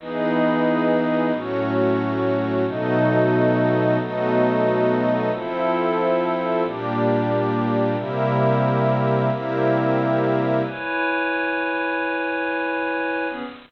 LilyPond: <<
  \new Staff \with { instrumentName = "Pad 5 (bowed)" } { \time 7/8 \key e \major \tempo 4 = 158 <e b dis' gis'>2.~ <e b dis' gis'>8 | <a, fis cis'>2.~ <a, fis cis'>8 | <b, fis a dis'>2.~ <b, fis a dis'>8 | <b, fis a dis'>2.~ <b, fis a dis'>8 |
\key f \major <f c' e' a'>2.~ <f c' e' a'>8 | <bes, g d'>2.~ <bes, g d'>8 | <c g bes e'>2.~ <c g bes e'>8 | <c g bes e'>2.~ <c g bes e'>8 |
\key e \major <e' b' cis'' gis''>2.~ <e' b' cis'' gis''>8~ | <e' b' cis'' gis''>2.~ <e' b' cis'' gis''>8 | <e b cis' gis'>4 r2 r8 | }
  \new Staff \with { instrumentName = "Pad 5 (bowed)" } { \time 7/8 \key e \major <e' gis' b' dis''>2.~ <e' gis' b' dis''>8 | <a fis' cis''>2.~ <a fis' cis''>8 | <b fis' a' dis''>2.~ <b fis' a' dis''>8 | <b fis' a' dis''>2.~ <b fis' a' dis''>8 |
\key f \major <f' a' c'' e''>2.~ <f' a' c'' e''>8 | <bes g' d''>2.~ <bes g' d''>8 | <c' g' bes' e''>2.~ <c' g' bes' e''>8 | <c' g' bes' e''>2.~ <c' g' bes' e''>8 |
\key e \major r2. r8 | r2. r8 | r2. r8 | }
>>